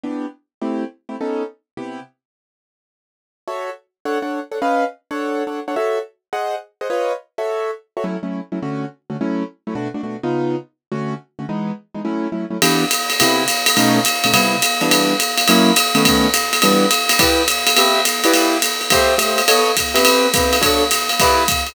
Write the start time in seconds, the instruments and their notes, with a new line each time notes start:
0.03 acoustic grand piano E3 B3 D4 G4
0.61 acoustic grand piano A3 C4 E4 G4
1.09 acoustic grand piano A3 C4 E4 G4
1.21 acoustic grand piano B3 C#4 D#4 A4
1.77 acoustic grand piano C3 B3 E4 G4
3.47 acoustic grand piano F#4 A4 C#5 E5
4.05 acoustic grand piano D4 A4 C#5 F#5
4.22 acoustic grand piano D4 A4 C#5 F#5
4.51 acoustic grand piano D4 A4 C#5 F#5
4.62 acoustic grand piano C#4 B4 D#5 F5
5.11 acoustic grand piano D4 A4 C#5 F#5
5.47 acoustic grand piano D4 A4 C#5 F#5
5.68 acoustic grand piano D4 A4 C#5 F#5
5.76 acoustic grand piano F#4 A4 C#5 E5
6.33 acoustic grand piano G#4 C5 D#5 F#5
6.81 acoustic grand piano G#4 C5 D#5 F#5
6.90 acoustic grand piano F4 B4 C#5 D#5
7.38 acoustic grand piano F#4 A4 C#5 E5
7.97 acoustic grand piano F#4 A4 C#5 E5
8.04 acoustic grand piano F#3 A3 C#4 E4
8.23 acoustic grand piano F#3 A3 C#4 E4
8.52 acoustic grand piano F#3 A3 C#4 E4
8.62 acoustic grand piano D3 A3 C#4 F#4
9.10 acoustic grand piano D3 A3 C#4 F#4
9.21 acoustic grand piano F#3 A3 C#4 E4
9.67 acoustic grand piano F#3 A3 C#4 E4
9.75 acoustic grand piano B2 A3 D4 F#4
9.94 acoustic grand piano B2 A3 D4 F#4
10.03 acoustic grand piano B2 A3 D4 F#4
10.23 acoustic grand piano C#3 B3 D#4 F4
10.92 acoustic grand piano D3 A3 C#4 F#4
11.39 acoustic grand piano D3 A3 C#4 F#4
11.49 acoustic grand piano E3 G#3 B3 D#4
11.94 acoustic grand piano E3 G#3 B3 D#4
12.05 acoustic grand piano F#3 A3 C#4 E4
12.32 acoustic grand piano F#3 A3 C#4 E4
12.50 acoustic grand piano F#3 A3 C#4 E4
12.62 acoustic grand piano E3 B3 D4 G4, ride
12.91 hi-hat pedal, ride
13.10 ride
13.20 acoustic grand piano C3 B3 E4 G4, ride
13.48 hi-hat pedal, ride
13.66 ride
13.77 acoustic grand piano B2 A3 C#4 D#4, ride
14.05 hi-hat pedal, ride
14.24 acoustic grand piano B2 A3 C#4 D#4, ride
14.33 acoustic grand piano C3 G3 B3 E4, ride
14.62 hi-hat pedal, ride
14.81 acoustic grand piano E3 G3 B3 D4, ride
14.91 ride
15.20 hi-hat pedal, ride
15.37 ride
15.48 acoustic grand piano F#3 A#3 C#4 E4, ride
15.76 hi-hat pedal, ride
15.95 acoustic grand piano D#3 A3 B3 C#4, ride
16.05 kick, ride
16.34 hi-hat pedal, ride
16.53 ride
16.62 acoustic grand piano E3 G3 B3 D4, ride
16.91 hi-hat pedal, ride
17.09 ride
17.19 acoustic grand piano E4 G4 B4 D5, kick, ride
17.48 hi-hat pedal, ride
17.67 ride
17.76 acoustic grand piano C4 G4 B4 E5, ride
18.05 hi-hat pedal, ride
18.24 acoustic grand piano E4 G4 B4 D5, ride
18.34 ride
18.62 hi-hat pedal, ride
18.81 ride
18.90 acoustic grand piano A3 G4 C5 E5, kick, ride
19.18 acoustic grand piano A3 G4 C5 E5, hi-hat pedal, ride
19.38 ride
19.48 acoustic grand piano B3 A4 C#5 D#5, ride
19.77 kick, hi-hat pedal, ride
19.94 acoustic grand piano C4 G4 B4 E5, ride
20.05 ride
20.34 acoustic grand piano C4 G4 B4 E5, kick, hi-hat pedal, ride
20.53 ride
20.61 acoustic grand piano D4 F#4 A4 C#5, kick, ride
20.91 hi-hat pedal, ride
21.09 ride
21.20 acoustic grand piano E4 G4 B4 D5, kick, ride
21.48 kick, hi-hat pedal, ride
21.67 ride